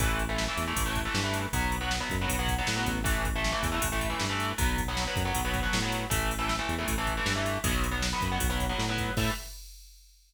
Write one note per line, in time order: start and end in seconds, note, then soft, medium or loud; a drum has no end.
0.00 0.49 A1 medium
0.00 0.23 E3 medium
0.00 0.23 A3 medium
0.00 kick loud
0.00 ride loud
0.19 ride medium
0.29 0.44 E3 medium
0.29 0.44 A3 medium
0.38 snare loud
0.48 0.64 E3 medium
0.48 0.64 A3 medium
0.57 0.74 E2 medium
0.57 ride medium
0.67 0.83 E3 medium
0.67 0.83 A3 medium
0.76 1.09 A1 medium
0.76 kick loud
0.76 ride loud
0.86 1.01 E3 medium
0.86 1.01 A3 medium
0.95 kick loud
0.95 ride medium
1.05 1.21 E3 medium
1.05 1.21 A3 medium
1.14 1.47 G2 medium
1.14 snare loud
1.24 1.47 E3 medium
1.24 1.47 A3 medium
1.34 ride medium
1.53 2.02 B1 medium
1.53 1.76 F#3 medium
1.53 1.76 B3 medium
1.53 kick loud
1.53 ride loud
1.72 ride medium
1.81 1.96 F#3 medium
1.81 1.96 B3 medium
1.91 snare loud
2.00 2.16 F#3 medium
2.00 2.16 B3 medium
2.10 2.27 F#2 medium
2.10 kick loud
2.10 ride medium
2.21 2.37 F#3 medium
2.21 2.37 B3 medium
2.29 2.62 B1 medium
2.29 kick medium
2.29 ride loud
2.39 2.54 F#3 medium
2.39 2.54 B3 medium
2.48 kick loud
2.48 ride medium
2.58 2.74 F#3 medium
2.58 2.74 B3 medium
2.67 2.86 A2 medium
2.67 snare loud
2.76 2.99 F#3 medium
2.76 2.99 B3 medium
2.86 3.55 A1 medium
2.86 kick medium
2.86 ride medium
3.04 3.27 E3 medium
3.04 3.27 A3 medium
3.04 kick loud
3.04 ride loud
3.25 kick loud
3.25 ride medium
3.36 3.51 E3 medium
3.36 3.51 A3 medium
3.44 snare loud
3.52 3.68 E3 medium
3.52 3.68 A3 medium
3.63 3.79 E2 medium
3.63 kick loud
3.63 ride loud
3.72 3.87 E3 medium
3.72 3.87 A3 medium
3.82 4.15 A1 medium
3.82 kick loud
3.82 ride loud
3.92 4.07 E3 medium
3.92 4.07 A3 medium
4.01 kick medium
4.01 ride medium
4.10 4.25 E3 medium
4.10 4.25 A3 medium
4.20 4.53 G2 medium
4.20 snare loud
4.30 4.52 E3 medium
4.30 4.52 A3 medium
4.40 ride medium
4.58 5.07 B1 medium
4.58 4.81 F#3 medium
4.58 4.81 B3 medium
4.58 kick loud
4.58 ride loud
4.78 kick loud
4.78 ride medium
4.88 5.04 F#3 medium
4.88 5.04 B3 medium
4.97 snare loud
5.07 5.23 F#3 medium
5.07 5.23 B3 medium
5.16 5.32 F#2 medium
5.16 kick loud
5.16 ride medium
5.25 5.41 F#3 medium
5.25 5.41 B3 medium
5.35 5.68 B1 medium
5.35 kick loud
5.35 ride loud
5.45 5.60 F#3 medium
5.45 5.60 B3 medium
5.54 kick loud
5.54 ride medium
5.63 5.78 F#3 medium
5.63 5.78 B3 medium
5.73 6.06 A2 medium
5.73 snare loud
5.82 6.05 F#3 medium
5.82 6.05 B3 medium
5.92 ride medium
6.10 6.60 A1 medium
6.10 6.33 E3 medium
6.10 6.33 A3 medium
6.10 kick loud
6.10 ride loud
6.31 ride medium
6.39 6.54 E3 medium
6.39 6.54 A3 medium
6.49 snare loud
6.59 6.74 E3 medium
6.59 6.74 A3 medium
6.69 6.85 E2 medium
6.69 ride medium
6.79 6.94 E3 medium
6.79 6.94 A3 medium
6.88 7.21 A1 medium
6.88 kick loud
6.88 ride loud
6.98 7.13 E3 medium
6.98 7.13 A3 medium
7.07 kick medium
7.07 ride medium
7.17 7.32 E3 medium
7.17 7.32 A3 medium
7.26 7.58 G2 medium
7.26 snare loud
7.36 7.58 E3 medium
7.36 7.58 A3 medium
7.46 ride medium
7.64 8.13 B1 medium
7.64 7.87 F#3 medium
7.64 7.87 B3 medium
7.64 kick loud
7.64 ride loud
7.84 ride medium
7.91 8.07 F#3 medium
7.91 8.07 B3 medium
8.02 snare loud
8.13 8.28 F#3 medium
8.13 8.28 B3 medium
8.21 8.38 F#2 medium
8.21 kick loud
8.21 ride medium
8.32 8.47 F#3 medium
8.32 8.47 B3 medium
8.40 8.73 B1 medium
8.40 kick loud
8.40 ride loud
8.50 8.65 F#3 medium
8.50 8.65 B3 medium
8.60 kick medium
8.60 ride medium
8.69 8.85 F#3 medium
8.69 8.85 B3 medium
8.79 9.11 A2 medium
8.79 snare loud
8.89 9.12 F#3 medium
8.89 9.12 B3 medium
8.98 kick loud
8.98 ride medium
9.17 9.30 A2 loud
9.17 9.31 E3 loud
9.17 9.31 A3 medium
9.17 kick loud
9.17 crash loud